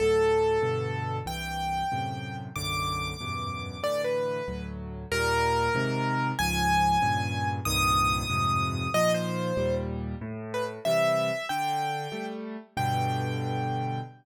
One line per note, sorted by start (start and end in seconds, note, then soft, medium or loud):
0.00 0.58 D2 medium
0.00 0.58 A2 medium
0.00 0.58 F#3 medium
0.00 1.16 A4 loud
0.62 1.20 G2 medium
0.62 1.20 B2 medium
0.62 1.20 D3 medium
1.26 1.83 C2 medium
1.26 1.83 G2 medium
1.26 1.83 E3 medium
1.26 2.37 G5 loud
1.92 2.49 F#2 medium
1.92 2.49 A2 medium
1.92 2.49 C3 medium
2.56 3.14 B1 medium
2.56 3.14 F#2 medium
2.56 3.14 A2 medium
2.56 3.14 D3 medium
2.56 3.80 D6 loud
3.20 3.78 E2 medium
3.20 3.78 F#2 medium
3.20 3.78 G2 medium
3.20 3.78 B2 medium
3.83 4.40 A2 medium
3.83 4.40 D3 medium
3.83 4.40 E3 medium
3.83 4.01 D5 loud
4.04 4.65 B4 medium
4.48 5.05 D2 medium
4.48 5.05 A2 medium
4.48 5.05 F#3 medium
5.12 5.69 D#2 medium
5.12 5.69 A#2 loud
5.12 5.69 G3 loud
5.12 6.28 A#4 loud
5.75 6.32 G#2 loud
5.75 6.32 C3 loud
5.75 6.32 D#3 medium
6.39 6.97 C#2 medium
6.39 6.97 G#2 medium
6.39 6.97 F3 medium
6.39 7.48 G#5 loud
7.02 7.60 G2 medium
7.02 7.60 A#2 medium
7.02 7.60 C#3 medium
7.65 8.24 C2 medium
7.65 8.24 G2 loud
7.65 8.24 A#2 medium
7.65 8.24 D#3 loud
7.65 8.90 D#6 loud
8.30 8.87 F2 medium
8.30 8.87 G2 medium
8.30 8.87 G#2 medium
8.30 8.87 C3 medium
8.94 9.52 A#2 medium
8.94 9.52 D#3 medium
8.94 9.52 F3 medium
8.94 9.12 D#5 loud
9.14 9.75 C5 loud
9.57 10.15 D#2 medium
9.57 10.15 A#2 medium
9.57 10.15 G3 medium
10.21 10.79 A2 loud
10.54 10.64 B4 loud
10.85 11.31 C3 medium
10.85 11.31 E3 medium
10.85 11.31 G3 medium
10.85 11.46 E5 loud
11.49 12.08 D3 loud
11.49 12.26 G5 loud
12.12 12.57 G3 medium
12.12 12.57 A3 medium
12.77 14.00 G2 loud
12.77 14.00 B2 loud
12.77 14.00 D3 loud
12.77 14.00 G5 loud